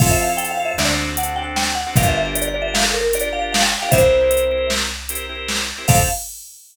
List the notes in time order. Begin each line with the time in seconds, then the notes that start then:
0.00 F2 C4 E4 F4 A4 F5, kick, crash
0.11 E5
0.21 F5
0.29 C4 E4 F4 A4
0.37 G5, closed hi-hat
0.51 F5
0.59 C4 E4 F4 A4
0.65 E5
0.78 D2 C4 D4 F#4 A4 D5, snare
1.17 C4 D4 F#4 A4 F#5, closed hi-hat
1.36 C4 D4 F#4 A4 G5
1.56 G5, snare
1.75 F#5
1.87 C4 D4 F#4 A4
1.96 G1 D4 F4 G4 A#4 F5, kick, closed hi-hat
2.08 E5
2.17 E5
2.25 D4 F4 G4 A#4
2.35 D5, closed hi-hat
2.48 D5
2.55 D4 F4 G4 A#4
2.62 E5
2.74 F5, snare
2.84 A4
2.94 A#4
3.13 D4 F4 G4 A#4 D5, closed hi-hat
3.33 D4 F4 G4 A#4 F5
3.52 F5, snare
3.62 G5
3.72 G5
3.82 D4 F4 G4 A#4 F5
3.91 C2 C4 E4 G4 A#4 C5 E5, kick, closed hi-hat
4.21 C4 E4 G4 A#4
4.31 closed hi-hat
4.51 C4 E4 G4 A#4
4.70 snare
5.09 C4 E4 G4 A#4, closed hi-hat
5.29 C4 E4 G4 A#4
5.48 snare
5.78 C4 E4 G4 A#4
5.88 F2 C4 E4 F4 A4 F5, kick, crash